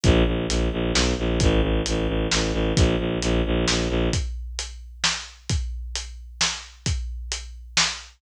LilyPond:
<<
  \new Staff \with { instrumentName = "Violin" } { \clef bass \time 3/4 \key bes \lydian \tempo 4 = 132 bes,,8 bes,,8 bes,,8 bes,,8 b,,8 bes,,8 | a,,8 a,,8 a,,8 a,,8 a,,8 a,,8 | bes,,8 bes,,8 bes,,8 bes,,8 bes,,8 bes,,8 | r2. |
r2. | r2. | }
  \new DrumStaff \with { instrumentName = "Drums" } \drummode { \time 3/4 <hh bd>4 hh4 sn4 | <hh bd>4 hh4 sn4 | <hh bd>4 hh4 sn4 | <hh bd>4 hh4 sn4 |
<hh bd>4 hh4 sn4 | <hh bd>4 hh4 sn4 | }
>>